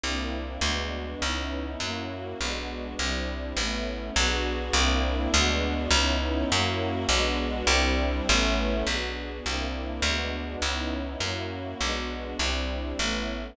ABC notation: X:1
M:6/8
L:1/8
Q:3/8=102
K:Bdor
V:1 name="String Ensemble 1"
[_B,=CDE]3 | [G,B,DF]3 [B,C^DE]3 | [^A,CEF]3 [G,B,DF]3 | [=G,=CDE]3 [A,B,^CE]3 |
[B,DFG]3 [_B,=CDE]3 | [G,B,DF]3 [B,C^DE]3 | [^A,CEF]3 [G,B,DF]3 | [=G,=CDE]3 [A,B,^CE]3 |
[B,DFG]3 [_B,=CDE]3 | [G,B,DF]3 [B,C^DE]3 | [^A,CEF]3 [G,B,DF]3 | [=G,=CDE]3 [A,B,^CE]3 |]
V:2 name="Electric Bass (finger)" clef=bass
=C,,3 | D,,3 C,,3 | F,,3 B,,,3 | =C,,3 A,,,3 |
B,,,3 =C,,3 | D,,3 C,,3 | F,,3 B,,,3 | =C,,3 A,,,3 |
B,,,3 =C,,3 | D,,3 C,,3 | F,,3 B,,,3 | =C,,3 A,,,3 |]